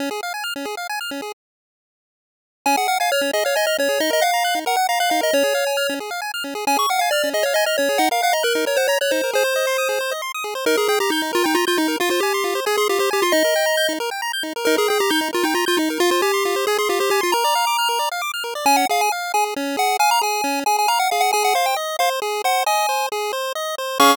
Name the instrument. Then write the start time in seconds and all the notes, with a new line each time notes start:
lead 1 (square)
0.00 C#4
0.11 G#4
0.23 F5
0.34 G#5
0.44 F6
0.56 C#4
0.65 G#4
0.77 F5
0.89 G#5
1.01 F6
1.11 C#4
1.22 G#4
2.66 C#4 G#5
2.77 G#4 F#5
2.88 F5 F#5
3.00 F5 G#5
3.12 C#5 F6
3.21 C#4
3.33 G#4 D#5
3.45 C#5 F5
3.56 D#5 G#5
3.67 D#5 F6
3.78 C#4 C#5
3.89 G#4
4.00 D#4 D#5
4.10 A#4 D#5
4.21 F5 F#5
4.34 A#5
4.44 F#6
4.55 D#4
4.66 A#4 F#5
4.76 F#5
4.89 F5 A#5
5.00 F5 F#6
5.10 D#4 F5
5.21 A#4 D#5
5.33 C#4 C#5
5.44 G#4
5.55 F5
5.67 G#5
5.77 F6
5.89 C#4
6.00 G#4
6.11 F5
6.22 G#5
6.34 F6
6.44 C#4
6.55 G#4
6.67 C#4 G#5
6.76 G#4 C#6
6.89 F5 F#5
6.99 F5 G#5
7.11 D5 F6
7.24 C#4
7.34 G#4 D#5
7.43 C#5 F5
7.54 D#5 G#5
7.66 D#5 F6
7.78 C#4 C#5
7.89 G#4
7.98 D#4 F#5
8.11 A#4 F5
8.22 F5 F#5
8.33 D#5 A#5
8.43 A#4 F#6
8.55 D#4
8.66 A#4 C#5
8.77 C5 F#5
8.88 C#5 A#5
9.01 C#5 F#6
9.11 D#4 C5
9.24 A#4
9.33 G#4 C5
9.44 C5
9.56 D#5
9.67 C6
9.78 D#6
9.89 G#4
10.01 C5
10.11 D#5
10.22 C6
10.34 D#6
10.44 G#4
10.55 C5
10.66 D#4 A#4
10.77 G#4 A#4
10.88 G#4 G5
11.00 G4 A#5
11.10 D#4 G6
11.22 D#4
11.33 F4 A#4
11.44 D#4 G5
11.55 F4 A#5
11.67 F4 G6
11.77 D#4
11.88 A#4
12.00 F4
12.10 F4 C5
12.20 G4 G#5
12.34 C6
12.44 F4
12.55 C5
12.66 G#4 G#5
12.77 G#4 C6
12.89 F4 G4
12.99 G4 C5
13.11 G4 G#5
13.22 F4 C6
13.32 D#4 D#5
13.44 A#4
13.56 G5
13.66 A#5
13.77 G6
13.89 D#4
14.00 A#4
14.11 G5
14.22 A#5
14.33 G6
14.43 D#4
14.56 A#4
14.65 D#4 A#4
14.77 G#4 A#4
14.88 G#4 G5
15.00 G4 A#5
15.10 D#4 G6
15.21 D#4
15.33 F4 A#4
15.43 D#4 G5
15.54 F4 A#5
15.66 F4 G6
15.77 D#4
15.90 A#4
16.00 F4
16.11 F4 C5
16.22 G4 G#5
16.34 C6
16.45 F4
16.56 C5
16.67 G#4 G#5
16.78 G#4 C6
16.89 F4 G4
17.00 G4 C5
17.10 G4 G#5
17.21 F4 C6
17.32 A#4 A#5
17.44 D5
17.55 F5
17.67 D6
17.79 F6
17.89 A#4
17.99 D5
18.12 F5
18.22 D6
18.34 F6
18.44 A#4
18.55 D5
18.65 C#4 G#5
18.77 F#5
18.89 G#4 F5
19.01 G#5
19.12 F5
19.34 G#4 G#5
19.56 C#4
19.77 G#4 F#5
19.99 F5 G#5
20.11 A#5
20.21 G#4 G#5
20.44 C#4
20.66 G#4 G#5
20.79 G#5
20.88 F5 A#5
20.99 F#5
21.11 G#4 F5
21.21 F#5
21.33 G#4 G#5
21.44 F#5
21.55 C5 F5
21.66 G5
21.76 D#5
21.99 C5 F5
22.22 G#4
22.44 C5 F#5
22.66 D#5 G#5
22.89 C5
23.12 G#4
23.33 C5
23.55 D#5
23.78 C5
24.00 C#4 G#4 F5 C#6